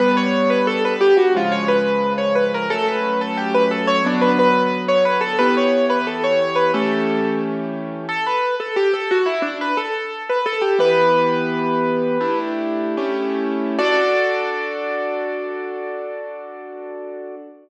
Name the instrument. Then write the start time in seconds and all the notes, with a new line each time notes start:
acoustic grand piano
0.00 G3 B3 D4 B4
0.17 C#5
0.50 B4
0.67 A4
0.85 B4
1.01 G4
1.17 F#4
1.35 C#3 F3 G#3 F4
1.52 C#5
1.68 B4
2.18 C#5
2.35 B4
2.54 A#4
2.70 F#3 A3 C#4 A4
2.88 B4
3.21 A4
3.37 G4
3.54 B4
3.71 A4
3.87 C#5
4.04 D3 F#3 B3 D4
4.21 B4
4.39 B4
4.88 C#5
5.05 B4
5.21 A4
5.39 E3 B3 G4 B4
5.57 C#5
5.90 B4
6.07 A4
6.24 C#5
6.41 C#5
6.55 B4
6.74 E3 A3 C#4 G4 A4
8.09 A4
8.27 B4
8.60 A4
8.76 G4
8.94 A4
9.11 F#4
9.26 E4
9.42 D4
9.61 B4
9.77 A4
10.29 B4
10.46 A4
10.61 G4
10.79 E3 B3 G4 B4
12.21 A3 D4 E4 G4
12.97 A3 C#4 E4 G4
13.79 D4 F#4 A4 D5